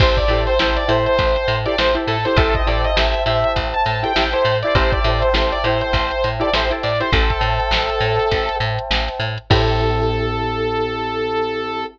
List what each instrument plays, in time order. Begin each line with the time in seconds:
0.00 electric bass (finger) A1, pizzicato strings E4 G4 A4 C5, electric piano 1 C5 E5 G5 A5, lead 2 (sawtooth) C5, kick, crash
0.17 lead 2 (sawtooth) D5, kick, closed hi-hat
0.28 electric bass (finger) A2, pizzicato strings E4 G4 A4, closed hi-hat
0.33 pizzicato strings C5
0.47 lead 2 (sawtooth) C5, closed hi-hat
0.59 electric bass (finger) A1, pizzicato strings E4 G4 A4 C5, lead 2 (sawtooth) C5, snare
0.77 lead 2 (sawtooth) D5, closed hi-hat
0.88 electric bass (finger) A2, pizzicato strings E4 G4 A4 C5, lead 2 (sawtooth) C5, snare, closed hi-hat
1.06 lead 2 (sawtooth) C5, closed hi-hat
1.19 electric bass (finger) A1, kick, closed hi-hat
1.36 closed hi-hat
1.48 electric bass (finger) A2, closed hi-hat
1.66 pizzicato strings E4 G4 A4 C5, lead 2 (sawtooth) D5, closed hi-hat
1.78 electric bass (finger) A1, pizzicato strings E4 G4 A4 C5, lead 2 (sawtooth) C5, snare
1.95 pizzicato strings E4 G4 A4 C5, closed hi-hat
2.07 electric bass (finger) A2, lead 2 (sawtooth) A4, closed hi-hat
2.25 pizzicato strings E4 G4 A4 C5, lead 2 (sawtooth) C5, snare, closed hi-hat
2.36 electric bass (finger) A1, pizzicato strings E4 G4 A4, lead 2 (sawtooth) A4, electric piano 1 C5 E5 G5 A5, kick, closed hi-hat
2.41 pizzicato strings C5
2.55 lead 2 (sawtooth) D#5, kick, closed hi-hat
2.66 electric bass (finger) A2, pizzicato strings E4 G4 A4 C5, lead 2 (sawtooth) D5, snare, closed hi-hat
2.84 lead 2 (sawtooth) D#5, closed hi-hat
2.96 electric bass (finger) A1, pizzicato strings E4 G4 A4 C5, lead 2 (sawtooth) E5, snare
3.14 closed hi-hat
3.26 electric bass (finger) A2, pizzicato strings E4 G4 A4 C5, lead 2 (sawtooth) E5, closed hi-hat
3.44 closed hi-hat
3.56 electric bass (finger) A1, kick, closed hi-hat
3.74 lead 2 (sawtooth) A5, closed hi-hat
3.86 electric bass (finger) A2, snare, closed hi-hat
4.03 pizzicato strings E4 G4 A4 C5, lead 2 (sawtooth) G5, closed hi-hat
4.16 electric bass (finger) A1, pizzicato strings E4 G4 A4 C5, lead 2 (sawtooth) G5, snare
4.33 pizzicato strings E4 G4 A4 C5, lead 2 (sawtooth) C5, closed hi-hat
4.45 electric bass (finger) A2, closed hi-hat
4.63 pizzicato strings E4 G4 A4, lead 2 (sawtooth) D5, closed hi-hat
4.67 pizzicato strings C5
4.75 electric bass (finger) A1, pizzicato strings E4 G4 A4 C5, lead 2 (sawtooth) C5, electric piano 1 C5 E5 G5 A5, kick, closed hi-hat
4.92 lead 2 (sawtooth) D5, kick, closed hi-hat
5.04 electric bass (finger) A2, pizzicato strings E4 G4 A4 C5, closed hi-hat
5.22 lead 2 (sawtooth) C5, closed hi-hat
5.33 electric bass (finger) A1, pizzicato strings E4 G4 A4 C5, lead 2 (sawtooth) C5, snare
5.52 lead 2 (sawtooth) D5, closed hi-hat
5.64 electric bass (finger) A2, pizzicato strings E4 G4 A4, lead 2 (sawtooth) C5, snare, closed hi-hat
5.69 pizzicato strings C5
5.81 lead 2 (sawtooth) C5, closed hi-hat
5.93 electric bass (finger) A1, kick, closed hi-hat
6.11 closed hi-hat
6.24 electric bass (finger) A2, closed hi-hat
6.40 pizzicato strings E4 G4 A4 C5, lead 2 (sawtooth) D5, closed hi-hat
6.53 electric bass (finger) A1, pizzicato strings E4 G4 A4 C5, lead 2 (sawtooth) C5, snare
6.70 pizzicato strings E4 G4 A4 C5, closed hi-hat
6.83 electric bass (finger) A2, lead 2 (sawtooth) D5, closed hi-hat
7.00 pizzicato strings E4 G4 A4 C5, lead 2 (sawtooth) C5, closed hi-hat
7.12 electric bass (finger) A1, lead 2 (sawtooth) A4, electric piano 1 C5 E5 G5 A5, kick, closed hi-hat
7.30 kick, snare, closed hi-hat
7.41 electric bass (finger) A2, closed hi-hat
7.60 closed hi-hat
7.71 electric bass (finger) A1, snare
7.89 closed hi-hat
8.00 electric bass (finger) A2, closed hi-hat
8.19 snare, closed hi-hat
8.31 electric bass (finger) A1, kick, closed hi-hat
8.49 closed hi-hat
8.60 electric bass (finger) A2, closed hi-hat
8.79 closed hi-hat
8.91 electric bass (finger) A1, snare
9.08 closed hi-hat
9.20 electric bass (finger) A2, closed hi-hat
9.38 closed hi-hat
9.50 electric bass (finger) A2, electric piano 1 C4 E4 G4 A4, pizzicato strings E4 G4 A4 C5, lead 2 (sawtooth) A4, kick, crash